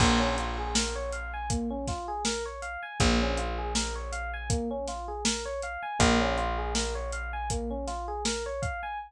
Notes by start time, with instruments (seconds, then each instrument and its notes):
0.00 electric bass (finger) A#1, electric piano 1 A#3, kick, crash
0.20 electric piano 1 C#4
0.38 electric piano 1 F4, closed hi-hat
0.58 electric piano 1 G#4
0.75 electric piano 1 A#4, snare
0.95 electric piano 1 C#5
1.12 electric piano 1 F5, closed hi-hat
1.33 electric piano 1 G#5
1.50 electric piano 1 A#3, kick, closed hi-hat
1.70 electric piano 1 C#4
1.88 electric piano 1 F4, kick, snare, closed hi-hat
2.08 electric piano 1 G#4
2.25 electric piano 1 A#4, snare
2.46 electric piano 1 C#5
2.62 electric piano 1 F5, closed hi-hat
2.83 electric piano 1 G#5
3.00 electric bass (finger) A#1, electric piano 1 A#3, kick, closed hi-hat
3.21 electric piano 1 C#4
3.37 electric piano 1 F4, closed hi-hat
3.58 electric piano 1 G#4
3.75 electric piano 1 A#4, snare
3.95 electric piano 1 C#5
4.12 electric piano 1 F5, closed hi-hat
4.33 electric piano 1 G#5
4.50 electric piano 1 A#3, kick, closed hi-hat
4.71 electric piano 1 C#4
4.88 electric piano 1 F4, snare, closed hi-hat
5.08 electric piano 1 G#4
5.25 electric piano 1 A#4, snare
5.45 electric piano 1 C#5
5.62 electric piano 1 F5, closed hi-hat
5.83 electric piano 1 G#5
5.99 electric bass (finger) A#1, electric piano 1 A#3, kick, closed hi-hat
6.21 electric piano 1 C#4
6.38 electric piano 1 F4, closed hi-hat
6.58 electric piano 1 G#4
6.75 electric piano 1 A#4, snare
6.95 electric piano 1 C#5
7.12 electric piano 1 F5, closed hi-hat
7.33 electric piano 1 G#5
7.50 electric piano 1 A#3, kick, closed hi-hat
7.70 electric piano 1 C#4
7.87 electric piano 1 F4, snare, closed hi-hat
8.08 electric piano 1 G#4
8.25 electric piano 1 A#4, snare
8.46 electric piano 1 C#5
8.62 electric piano 1 F5, kick, closed hi-hat
8.83 electric piano 1 G#5